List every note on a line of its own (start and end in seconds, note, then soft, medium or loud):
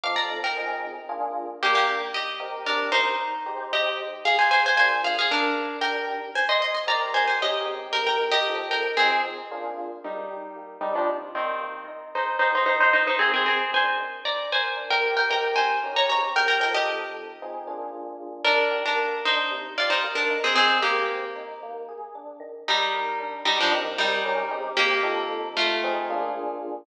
0.04 0.40 F3 loud
0.04 0.40 C4 loud
0.04 0.40 D#4 loud
0.04 0.40 A4 loud
0.04 0.16 F5 medium
0.04 0.16 D6 medium
0.16 0.40 D5 medium
0.16 0.40 A#5 medium
0.44 1.02 A#4 medium
0.44 1.02 G5 medium
0.57 0.94 F3 medium
0.57 0.94 C4 loud
0.57 0.94 D#4 loud
0.57 0.94 G#4 loud
1.09 1.46 A#3 loud
1.09 1.46 D4 loud
1.09 1.46 F4 loud
1.09 1.46 G#4 loud
1.63 2.00 D#3 medium
1.63 1.74 A#3 medium
1.63 2.00 D4 medium
1.63 1.74 G4 medium
1.63 2.00 G4 loud
1.63 2.00 A#4 loud
1.75 1.99 A#3 medium
1.75 1.99 G4 medium
2.14 2.58 G4 medium
2.14 2.58 D#5 medium
2.40 3.03 C4 medium
2.40 3.03 D#4 medium
2.40 3.03 G4 loud
2.40 3.03 A#4 loud
2.66 2.89 D4 soft
2.66 2.89 A#4 medium
2.92 3.65 D#4 medium
2.92 3.65 C5 medium
3.46 4.09 G#3 loud
3.46 4.09 D#4 loud
3.46 4.09 G4 loud
3.46 4.09 C5 loud
3.73 3.98 G4 medium
3.73 3.98 D#5 medium
4.25 4.38 G#4 medium
4.25 4.38 F5 medium
4.39 4.50 C5 soft
4.39 4.50 G#5 medium
4.51 4.63 C5 medium
4.51 4.63 G#5 medium
4.66 4.77 C5 medium
4.66 4.77 G#5 medium
4.76 5.13 A#3 medium
4.76 5.13 D4 medium
4.76 5.13 F4 medium
4.76 5.13 G#4 medium
4.76 5.02 C5 medium
4.76 5.02 G#5 medium
5.04 5.17 G#4 medium
5.04 5.17 F5 medium
5.19 5.31 G#4 medium
5.19 5.31 F5 medium
5.31 5.77 D4 medium
5.31 5.77 A#4 medium
5.81 6.18 D#3 loud
5.81 6.18 D4 loud
5.81 6.18 G4 medium
5.81 6.18 A#4 medium
5.81 6.06 A#4 medium
5.81 6.06 G5 medium
6.35 6.48 C5 medium
6.35 6.48 G#5 medium
6.49 6.61 D#5 medium
6.49 6.61 C6 medium
6.62 6.74 D#5 medium
6.62 6.74 C6 medium
6.74 6.87 D#5 soft
6.74 6.87 C6 soft
6.87 7.24 C4 loud
6.87 7.24 D#4 loud
6.87 7.24 G4 loud
6.87 7.24 A#4 loud
6.87 7.10 D5 medium
6.87 7.10 A#5 medium
7.14 7.27 C5 medium
7.14 7.27 G#5 medium
7.28 7.40 C5 soft
7.28 7.40 G#5 medium
7.41 7.66 D#3 medium
7.41 7.66 C#4 loud
7.41 7.64 G4 medium
7.41 7.89 G4 medium
7.41 7.66 A#4 medium
7.41 7.89 D#5 medium
7.65 8.28 G#3 loud
7.65 8.28 C4 medium
7.65 8.28 D#4 loud
7.65 8.28 G4 loud
7.93 8.05 A#4 medium
7.93 8.05 G5 medium
8.07 8.29 A#4 medium
8.07 8.29 G5 medium
8.31 8.67 G4 medium
8.31 8.67 D#5 medium
8.47 8.84 F3 medium
8.47 8.84 C4 loud
8.47 8.84 D#4 medium
8.47 8.84 A4 medium
8.71 8.95 A#4 medium
8.71 8.95 G5 medium
8.97 9.36 F3 loud
8.97 9.22 C4 medium
8.97 9.36 C4 medium
8.97 9.36 D#4 loud
8.97 9.22 G#4 medium
8.97 9.36 G#4 medium
9.51 9.88 A#3 loud
9.51 9.88 D4 loud
9.51 9.88 F4 loud
9.51 9.88 G#4 medium
10.04 10.31 D#3 loud
10.04 10.77 G3 medium
10.04 10.77 D#4 medium
10.31 10.57 G4 medium
10.56 10.82 A#3 medium
10.81 10.93 G3 soft
10.81 11.07 D4 medium
10.81 10.93 D#4 medium
10.95 11.08 F3 medium
10.95 11.08 D4 medium
11.07 11.34 C3 loud
11.35 11.84 D#3 soft
11.35 11.84 C4 medium
11.35 11.63 G4 medium
11.61 11.87 A#3 medium
11.88 12.13 D#4 medium
12.15 12.41 G#3 medium
12.15 12.37 D#4 medium
12.15 12.37 C5 medium
12.39 12.52 D#4 medium
12.39 12.67 G4 medium
12.39 12.52 C5 medium
12.55 12.65 D#4 medium
12.55 12.65 C5 medium
12.66 12.94 C4 medium
12.66 12.79 D#4 medium
12.66 12.79 C5 medium
12.80 12.93 D#4 medium
12.80 12.93 C5 medium
12.93 13.18 D#4 medium
12.93 13.06 D#4 soft
12.93 13.06 C5 medium
13.07 13.20 D#4 medium
13.07 13.20 C5 medium
13.19 13.45 A#3 medium
13.19 13.31 C4 medium
13.19 13.31 G#4 medium
13.34 13.45 C4 medium
13.34 13.45 G#4 medium
13.45 13.71 C4 medium
13.45 13.71 G#4 medium
13.72 13.99 D4 medium
13.72 14.21 C5 medium
13.72 14.21 G#5 medium
13.98 14.50 D#3 medium
14.25 14.48 D5 medium
14.25 14.48 A#5 medium
14.52 14.79 A#4 medium
14.52 14.90 C5 medium
14.52 14.90 G#5 medium
14.77 15.03 D4 medium
14.90 15.12 A#4 medium
14.90 15.12 G5 medium
15.02 15.27 G4 medium
15.17 15.29 A#4 soft
15.17 15.29 G5 medium
15.29 15.77 C4 medium
15.29 15.77 D#4 loud
15.29 15.77 G4 medium
15.29 15.77 A#4 medium
15.29 15.52 A#4 medium
15.29 15.52 G5 medium
15.56 15.88 C5 medium
15.56 15.88 G#5 medium
15.83 16.08 D#3 loud
15.83 16.08 C#4 loud
15.83 16.08 G4 medium
15.83 16.08 A#4 medium
15.96 16.09 C#5 medium
15.96 16.09 A#5 medium
16.09 16.59 G#3 medium
16.09 16.59 C4 medium
16.09 16.59 D#4 medium
16.09 16.59 G4 loud
16.09 16.32 C#5 medium
16.09 16.32 A#5 medium
16.36 16.47 A#4 medium
16.36 16.47 G5 medium
16.48 16.60 A#4 medium
16.48 16.60 G5 medium
16.60 17.34 F3 loud
16.60 17.34 C4 medium
16.60 17.34 D#4 medium
16.60 17.34 A4 medium
16.60 16.74 A#4 medium
16.60 16.74 G5 medium
16.74 17.78 G4 medium
16.74 17.78 D#5 medium
17.42 17.67 F3 medium
17.42 17.67 C4 loud
17.42 17.67 D#4 medium
17.42 17.67 G#4 medium
17.67 18.41 A#3 medium
17.67 18.41 D4 loud
17.67 18.41 F4 medium
17.67 18.41 G#4 medium
18.45 18.73 D#3 loud
18.45 18.82 D4 medium
18.45 18.82 A#4 medium
18.71 18.97 G4 medium
18.86 19.20 D4 soft
18.86 19.20 A#4 medium
18.99 19.25 A#3 medium
19.25 19.51 D4 loud
19.25 19.74 D#4 medium
19.25 19.74 C5 medium
19.51 19.77 C3 loud
19.78 19.90 F4 medium
19.78 20.06 G4 loud
19.78 19.90 D5 medium
19.90 20.02 D#4 medium
19.90 20.02 C5 medium
20.04 20.30 A#3 medium
20.15 20.37 D4 medium
20.15 20.37 A#4 medium
20.30 20.55 D#4 loud
20.44 20.55 C4 medium
20.44 20.55 G#4 medium
20.55 20.82 G#3 loud
20.55 20.78 C4 medium
20.55 20.78 G#4 medium
20.82 21.49 A#3 medium
20.82 21.49 G4 medium
20.82 21.10 G4 loud
21.08 21.35 C4 loud
21.35 21.60 D#4 loud
21.63 21.89 A#3 loud
21.89 22.15 G#4 medium
22.15 22.41 D4 medium
22.40 22.92 D#3 loud
22.68 23.36 G3 medium
22.68 23.36 D#4 medium
22.93 23.20 A#4 loud
23.20 23.46 D4 loud
23.45 23.58 G3 medium
23.45 23.58 D#4 medium
23.45 23.71 G4 loud
23.60 23.73 F3 medium
23.60 23.73 D4 medium
23.72 24.19 C4 loud
23.72 24.19 D#4 loud
23.72 24.19 G4 loud
23.72 24.19 A#4 loud
23.98 24.43 G3 medium
23.98 24.43 D#4 medium
24.25 24.50 D#3 loud
24.25 24.50 C#4 loud
24.25 24.50 G4 loud
24.25 24.50 A#4 loud
24.51 25.01 G#3 loud
24.51 25.01 C4 loud
24.51 25.01 D#4 loud
24.51 25.01 G4 loud
24.77 25.48 A#3 medium
24.77 25.48 G4 medium
25.03 25.77 F3 loud
25.03 25.77 C4 loud
25.03 25.77 D#4 loud
25.03 25.77 A4 loud
25.57 26.23 A3 medium
25.57 26.23 F4 medium
25.84 26.09 F3 loud
25.84 26.09 C4 loud
25.84 26.09 D#4 loud
25.84 26.09 G#4 loud
26.10 26.84 A#3 loud
26.10 26.84 D4 loud
26.10 26.84 F4 loud
26.10 26.84 G#4 loud